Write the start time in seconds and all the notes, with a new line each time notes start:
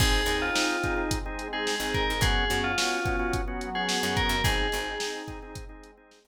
0.00 G#1 C4 D#4 G#4, kick, crash
0.26 D#2 C4 D#4 G#4, closed hi-hat
0.42 F4
0.55 C4 D#4 G#4, snare
0.83 C4 D#4 G#4, kick, closed hi-hat
0.97 C4 D#4 G#4
1.09 G#3 C4 G#4, kick, closed hi-hat
1.26 C4 D#4 G#4
1.39 closed hi-hat
1.53 C4 D#4 G#4
1.67 snare
1.80 G#1 C4 D#4 G#4
1.94 A#4, kick, closed hi-hat
2.10 G#2
2.21 F#2 B3 C#4 F#4 G#4, kick, closed hi-hat
2.50 F#2 B3 C#4 F#4, closed hi-hat
2.64 F4
2.78 B3 C#4 F#4, snare
3.05 B3 C#4 F#4, kick, closed hi-hat
3.19 B3 C#4 F#4
3.33 F#3 B3 F#4, kick, closed hi-hat
3.48 B3 C#4 F#4
3.61 closed hi-hat
3.75 B3 C#4 F#4 G#4
3.89 snare
4.03 F#2 B3 C#4 F#4
4.17 A#4, kick, closed hi-hat
4.29 F#2
4.44 G#1 C4 D#4 G#4, kick, closed hi-hat
4.72 G#1 C4 D#4 G#4, closed hi-hat
5.00 C4 D#4 G#4, snare
5.28 C4 D#4 G#4, kick, closed hi-hat
5.42 C4 D#4 G#4
5.55 G#3 C4 G#4, kick, closed hi-hat
5.69 C4 D#4 G#4
5.83 closed hi-hat
5.97 C4 D#4 G#4
6.11 snare
6.24 G#1 C4 D#4 G#4